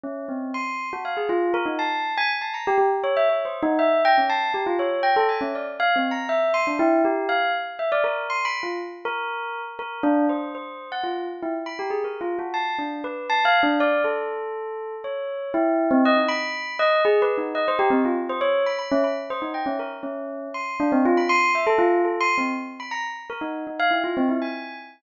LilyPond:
\new Staff { \time 5/8 \tempo 4 = 120 cis'8 c'8 c'''8. fis'16 f''16 gis'16 | f'8 ais'16 dis'16 a''8. gis''16 r16 a''16 | ais''16 g'16 g'16 r16 cis''16 e''16 \tuplet 3/2 { cis''8 c''8 dis'8 } | e''8 g''16 cis'16 a''8 g'16 f'16 cis''8 |
g''16 a'16 gis''16 cis'16 d''16 r16 \tuplet 3/2 { f''8 c'8 ais''8 } | e''8 c'''16 d'16 e'8 g'8 f''8 | r8 e''16 d''16 ais'8 \tuplet 3/2 { c'''8 b''8 f'8 } | r8 ais'4~ ais'16 r16 ais'8 |
d'8 c''8 c''8. fis''16 f'8 | r16 e'16 r16 b''16 g'16 gis'16 \tuplet 3/2 { ais'8 f'8 fis'8 } | a''8 d'8 b'8 \tuplet 3/2 { a''8 f''8 d'8 } | d''8 a'2 |
cis''4 e'8. c'16 dis''16 dis'16 | b''4 dis''8 \tuplet 3/2 { gis'8 b'8 dis'8 } | dis''16 c''16 g'16 c'16 f'16 r16 c''16 cis''8 b''16 | b''16 cis'16 b''16 r16 c''16 dis'16 g''16 cis'16 ais'16 r16 |
cis'4 c'''8 d'16 c'16 f'16 b''16 | c'''8 e''16 a'16 f'8 \tuplet 3/2 { a'8 c'''8 c'8 } | r8 b''16 ais''16 r8 ais'16 dis'8 dis'16 | f''16 e'16 f'16 c'16 e'16 gis''8. r8 | }